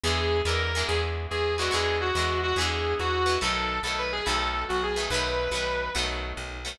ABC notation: X:1
M:12/8
L:1/8
Q:3/8=142
K:Bmix
V:1 name="Distortion Guitar"
G3 ^A3 G z2 G2 F | G2 F3 F G3 F3 | A3 A B G A3 F G2 | B6 z6 |]
V:2 name="Acoustic Guitar (steel)"
[=D,E,G,B,]3 [D,E,G,B,]2 [D,E,G,B,]6 [D,E,G,B,] | [=D,E,G,B,]3 [D,E,G,B,]3 [D,E,G,B,]5 [D,E,G,B,] | [D,F,A,B,]3 [D,F,A,B,]3 [D,F,A,B,]5 [D,F,A,B,] | [D,F,A,B,]3 [D,F,A,B,]3 [D,F,A,B,]5 [D,F,A,B,] |]
V:3 name="Electric Bass (finger)" clef=bass
E,,3 E,,3 E,,3 E,,3 | E,,3 E,,3 E,,3 E,,3 | B,,,3 B,,,3 B,,,3 B,,,3 | B,,,3 B,,,3 B,,,3 B,,,3 |]